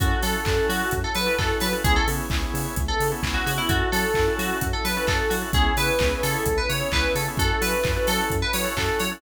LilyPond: <<
  \new Staff \with { instrumentName = "Electric Piano 2" } { \time 4/4 \key fis \minor \tempo 4 = 130 fis'8 a'4 fis'8. a'16 b'8 a'8 b'16 r16 | gis'16 a'16 r4. r16 a'8 r8 fis'16 fis'16 e'16 | fis'8 a'4 fis'8. a'16 b'8 a'8 fis'16 r16 | gis'8 b'4 a'8. b'16 cis''8 b'8 a'16 r16 |
a'8 b'4 a'8. b'16 cis''8 a'8 cis''16 r16 | }
  \new Staff \with { instrumentName = "Drawbar Organ" } { \time 4/4 \key fis \minor <cis' e' fis' a'>8 <cis' e' fis' a'>8 <cis' e' fis' a'>16 <cis' e' fis' a'>4. <cis' e' fis' a'>16 <cis' e' fis' a'>8. <cis' e' fis' a'>16 | <b cis' e' gis'>8 <b cis' e' gis'>8 <b cis' e' gis'>16 <b cis' e' gis'>4. <b cis' e' gis'>16 <b cis' e' gis'>8. <b cis' e' gis'>16 | <cis' e' fis' a'>8 <cis' e' fis' a'>8 <cis' e' fis' a'>16 <cis' e' fis' a'>4. <cis' e' fis' a'>16 <cis' e' fis' a'>8. <cis' e' fis' a'>16 | <b cis' e' gis'>8 <b cis' e' gis'>8 <b cis' e' gis'>16 <b cis' e' gis'>4. <b cis' e' gis'>16 <b cis' e' gis'>8. <b cis' e' gis'>16 |
<cis' e' fis' a'>8 <cis' e' fis' a'>8 <cis' e' fis' a'>16 <cis' e' fis' a'>4. <cis' e' fis' a'>16 <cis' e' fis' a'>8. <cis' e' fis' a'>16 | }
  \new Staff \with { instrumentName = "Synth Bass 1" } { \clef bass \time 4/4 \key fis \minor fis,8 fis8 fis,8 fis8 fis,8 fis8 fis,8 fis8 | cis,8 cis8 cis,8 cis8 cis,8 cis8 cis,8 cis8 | fis,8 fis8 fis,8 fis8 fis,8 fis8 fis,8 fis8 | cis,8 cis8 cis,8 cis8 cis,8 cis8 cis,8 cis8 |
fis,8 fis8 fis,8 fis8 fis,8 fis8 fis,8 fis8 | }
  \new Staff \with { instrumentName = "Pad 5 (bowed)" } { \time 4/4 \key fis \minor <cis' e' fis' a'>1 | <b cis' e' gis'>1 | <cis' e' fis' a'>1 | <b cis' e' gis'>1 |
<cis' e' fis' a'>1 | }
  \new DrumStaff \with { instrumentName = "Drums" } \drummode { \time 4/4 <hh bd>8 hho8 <hc bd>8 hho8 <hh bd>8 hho8 <hc bd>8 hho8 | <hh bd>8 hho8 <hc bd>8 hho8 <hh bd>8 hho8 <hc bd>8 hho8 | <hh bd>8 hho8 <hc bd>8 hho8 <hh bd>8 hho8 <hc bd>8 hho8 | <hh bd>8 hho8 <hc bd>8 hho8 <hh bd>8 hho8 <hc bd>8 hho8 |
<hh bd>8 hho8 <hc bd>8 hho8 <hh bd>8 hho8 <hc bd>8 hho8 | }
>>